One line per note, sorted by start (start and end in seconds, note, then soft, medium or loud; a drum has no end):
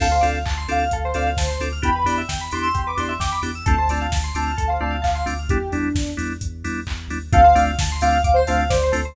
0.00 0.19 D2 medium
0.00 0.07 C4 loud
0.00 0.07 D4 loud
0.00 0.07 F4 medium
0.00 0.07 A4 loud
0.00 0.12 A4 medium
0.00 0.26 F5 medium
0.00 kick loud
0.00 crash loud
0.12 0.22 C5 medium
0.21 0.44 D2 medium
0.21 0.39 C4 medium
0.21 0.39 D4 medium
0.21 0.39 F4 medium
0.21 0.39 A4 medium
0.21 0.31 D5 medium
0.21 open hi-hat medium
0.34 0.44 F5 soft
0.46 0.66 D2 medium
0.46 0.56 A5 medium
0.46 kick medium
0.46 clap loud
0.57 0.68 C6 medium
0.68 0.87 D2 medium
0.68 0.84 C4 medium
0.68 0.84 D4 loud
0.68 0.84 F4 medium
0.68 0.84 A4 medium
0.68 0.99 F5 medium
0.68 0.79 D6 medium
0.68 open hi-hat medium
0.79 0.90 F6 medium
0.91 1.11 D2 medium
0.91 1.03 A4 medium
0.91 kick medium
0.91 closed hi-hat loud
1.04 1.15 C5 medium
1.14 1.34 D2 medium
1.14 1.30 C4 loud
1.14 1.30 D4 medium
1.14 1.30 F4 medium
1.14 1.30 A4 medium
1.14 1.26 D5 medium
1.14 1.25 F5 medium
1.14 open hi-hat medium
1.26 1.37 F5 soft
1.37 1.57 D2 medium
1.37 1.58 C5 medium
1.37 1.48 A5 medium
1.37 kick medium
1.37 snare loud
1.48 1.58 C6 medium
1.60 1.80 D2 medium
1.60 1.69 C4 medium
1.60 1.69 D4 medium
1.60 1.69 F4 medium
1.60 1.69 A4 medium
1.60 1.72 D6 medium
1.60 open hi-hat medium
1.72 1.83 F6 medium
1.82 2.04 E2 medium
1.82 1.90 B3 loud
1.82 1.90 D4 loud
1.82 1.90 E4 loud
1.82 1.90 G4 loud
1.82 1.95 G4 medium
1.82 2.13 B5 medium
1.82 kick loud
1.82 closed hi-hat loud
1.96 2.06 B4 soft
2.04 2.24 E2 medium
2.04 2.22 B3 loud
2.04 2.22 D4 medium
2.04 2.22 E4 medium
2.04 2.22 G4 medium
2.04 2.17 D5 medium
2.04 open hi-hat medium
2.18 2.28 E5 medium
2.29 2.49 E2 medium
2.29 2.39 G5 medium
2.29 kick medium
2.29 snare loud
2.41 2.51 B5 medium
2.51 2.72 E2 medium
2.51 2.68 B3 medium
2.51 2.68 D4 medium
2.51 2.68 E4 medium
2.51 2.68 G4 medium
2.51 2.81 C6 medium
2.51 2.62 D6 medium
2.51 open hi-hat medium
2.63 2.73 E6 medium
2.74 2.95 E2 medium
2.74 2.85 G4 medium
2.74 kick medium
2.74 closed hi-hat medium
2.86 2.97 B4 medium
2.86 2.97 D6 medium
2.97 3.17 E2 medium
2.97 3.13 B3 medium
2.97 3.13 D4 medium
2.97 3.13 E4 medium
2.97 3.13 G4 medium
2.97 3.10 D5 soft
2.97 3.08 C6 medium
2.97 open hi-hat medium
3.09 3.19 E5 medium
3.20 3.39 E2 medium
3.20 3.30 G5 medium
3.20 3.39 D6 medium
3.20 kick medium
3.20 snare loud
3.32 3.42 B5 medium
3.42 3.62 E2 medium
3.42 3.51 B3 medium
3.42 3.51 D4 medium
3.42 3.51 E4 medium
3.42 3.51 G4 medium
3.42 3.52 D6 medium
3.42 open hi-hat medium
3.55 3.65 E6 medium
3.66 3.87 D2 medium
3.66 3.75 A3 loud
3.66 3.75 C4 loud
3.66 3.75 D4 loud
3.66 3.75 F4 loud
3.66 3.76 A4 medium
3.66 4.00 A5 medium
3.66 kick loud
3.66 closed hi-hat loud
3.78 3.89 C5 medium
3.88 4.08 D2 medium
3.88 4.07 A3 medium
3.88 4.07 C4 medium
3.88 4.07 D4 medium
3.88 4.07 F4 medium
3.88 4.00 D5 medium
3.88 open hi-hat medium
4.01 4.12 F5 medium
4.10 4.30 D2 medium
4.10 4.24 A5 medium
4.10 kick medium
4.10 snare loud
4.24 4.34 C6 medium
4.35 4.54 D2 medium
4.35 4.52 A3 medium
4.35 4.52 C4 medium
4.35 4.52 D4 medium
4.35 4.52 F4 medium
4.35 4.67 A5 medium
4.35 4.45 D6 medium
4.35 open hi-hat medium
4.47 4.57 F6 medium
4.58 4.78 D2 medium
4.58 4.68 A4 medium
4.58 kick medium
4.58 closed hi-hat loud
4.67 4.80 C5 soft
4.67 4.78 F5 medium
4.81 5.01 D2 medium
4.81 4.97 A3 medium
4.81 4.97 C4 medium
4.81 4.97 D4 medium
4.81 4.97 F4 medium
4.81 4.91 D5 medium
4.81 4.92 A5 medium
4.90 5.01 F5 medium
5.02 5.23 D2 medium
5.02 5.22 F5 medium
5.02 5.12 A5 medium
5.02 kick medium
5.02 clap loud
5.02 open hi-hat medium
5.15 5.26 C6 medium
5.26 5.47 D2 medium
5.26 5.34 A3 medium
5.26 5.34 C4 medium
5.26 5.34 D4 medium
5.26 5.34 F4 medium
5.26 5.37 D6 medium
5.26 open hi-hat medium
5.39 5.49 F6 soft
5.49 5.68 E2 medium
5.49 5.58 G3 loud
5.49 5.58 B3 loud
5.49 5.58 D4 loud
5.49 5.58 E4 loud
5.49 5.68 G4 medium
5.49 kick loud
5.49 closed hi-hat loud
5.72 5.92 E2 medium
5.72 5.89 G3 medium
5.72 5.89 B3 medium
5.72 6.10 D4 medium
5.72 5.89 D4 medium
5.72 5.89 E4 medium
5.72 open hi-hat medium
5.95 6.14 E2 medium
5.95 kick loud
5.95 snare loud
6.17 6.38 E2 medium
6.17 6.33 G3 medium
6.17 6.33 B3 medium
6.17 6.33 D4 medium
6.17 6.33 E4 medium
6.17 open hi-hat medium
6.41 6.62 E2 medium
6.41 kick medium
6.41 closed hi-hat loud
6.64 6.85 E2 medium
6.64 6.80 G3 medium
6.64 6.80 B3 medium
6.64 6.80 D4 medium
6.64 6.80 E4 medium
6.64 open hi-hat medium
6.87 7.08 E2 medium
6.87 kick medium
6.87 clap loud
7.08 7.29 D#2 medium
7.08 7.18 G3 medium
7.08 7.18 B3 medium
7.08 7.18 D4 loud
7.08 7.18 E4 medium
7.08 open hi-hat medium
7.33 7.54 D2 medium
7.33 7.41 A3 loud
7.33 7.41 C4 loud
7.33 7.41 D4 loud
7.33 7.41 F4 loud
7.33 7.44 A4 medium
7.33 7.60 F5 loud
7.33 kick loud
7.33 closed hi-hat loud
7.44 7.54 C5 medium
7.55 7.75 D2 medium
7.55 7.71 A3 loud
7.55 7.71 C4 loud
7.55 7.71 D4 loud
7.55 7.71 F4 medium
7.55 7.66 D5 medium
7.55 open hi-hat medium
7.67 7.77 F5 medium
7.79 7.99 D2 medium
7.79 7.91 A5 medium
7.79 kick loud
7.79 snare loud
7.92 8.02 C6 medium
8.01 8.21 D2 medium
8.01 8.18 A3 medium
8.01 8.18 C4 loud
8.01 8.18 D4 medium
8.01 8.18 F4 loud
8.01 8.30 F5 loud
8.01 8.13 D6 medium
8.01 open hi-hat loud
8.13 8.23 F6 medium
8.24 8.43 D2 medium
8.24 8.35 D6 medium
8.24 kick loud
8.24 closed hi-hat loud
8.34 8.45 C5 loud
8.34 8.46 C6 medium
8.47 8.68 D2 medium
8.47 8.64 A3 loud
8.47 8.64 C4 medium
8.47 8.64 D4 loud
8.47 8.64 F4 loud
8.47 8.57 F5 loud
8.47 8.58 A5 medium
8.47 open hi-hat medium
8.59 8.69 F5 medium
8.69 8.91 D2 medium
8.69 8.91 C5 loud
8.69 8.81 D5 medium
8.69 kick loud
8.69 snare loud
8.83 8.94 C5 medium
8.92 9.12 D2 medium
8.92 9.01 A3 loud
8.92 9.01 C4 loud
8.92 9.01 D4 loud
8.92 9.01 F4 loud
8.92 9.02 A4 medium
8.92 open hi-hat medium
9.05 9.15 C5 medium